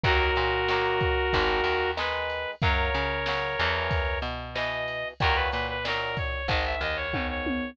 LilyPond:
<<
  \new Staff \with { instrumentName = "Brass Section" } { \time 4/4 \key fis \mixolydian \tempo 4 = 93 <fis' ais'>2. b'4 | <ais' cis''>2. dis''4 | ais'16 b'16 b'16 b'16 ais'8 cis''8 dis''16 e''16 dis''16 cis''8 cis''8. | }
  \new Staff \with { instrumentName = "Acoustic Guitar (steel)" } { \time 4/4 \key fis \mixolydian <dis fis ais>4 <dis fis ais>4 <dis gis>4 <dis gis>4 | <cis fis>4 <cis fis>8 <b, e>4. <b, e>4 | <ais, dis fis>4 <ais, dis fis>4 <gis, dis>4 <gis, dis>4 | }
  \new Staff \with { instrumentName = "Electric Bass (finger)" } { \clef bass \time 4/4 \key fis \mixolydian dis,8 ais,4. gis,,8 dis,4. | fis,8 cis4 e,4 b,4. | dis,8 ais,4. gis,,8 dis,4. | }
  \new DrumStaff \with { instrumentName = "Drums" } \drummode { \time 4/4 <bd cymr>8 cymr8 sn8 <bd cymr>8 <bd cymr>8 cymr8 sn8 cymr8 | <bd cymr>8 cymr8 sn8 cymr8 <bd cymr>8 cymr8 sn8 cymr8 | <bd cymr>8 cymr8 sn8 <bd cymr>8 <bd cymr>8 cymr8 <bd tommh>8 tommh8 | }
>>